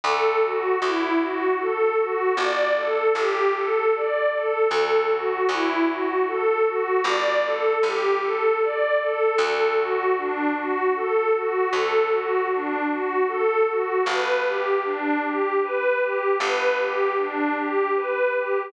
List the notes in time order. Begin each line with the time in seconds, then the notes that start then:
0.04 D2 A4
0.43 F#4
0.82 D2 E4
1.20 F#4
1.60 A4
1.98 F#4
2.37 G1 D5
2.77 A4
3.15 G1 G4
3.55 A4
3.93 D5
4.32 A4
4.70 D2 A4
5.10 F#4
5.49 D2 E4
5.88 F#4
6.27 A4
6.65 F#4
7.04 G1 D5
7.44 A4
7.83 G1 G4
8.21 A4
8.61 D5
9.00 A4
9.38 D2 A4
9.77 F#4
10.17 D4
10.56 F#4
10.95 A4
11.34 F#4
11.71 D2 A4
12.11 F#4
12.51 D4
12.89 F#4
13.28 A4
13.66 F#4
14.06 G1 B4
14.45 G4
14.85 D4
15.24 G4
15.63 B4
16.00 G4
16.40 G1 B4
16.79 G4
17.19 D4
17.57 G4
17.96 B4
18.35 G4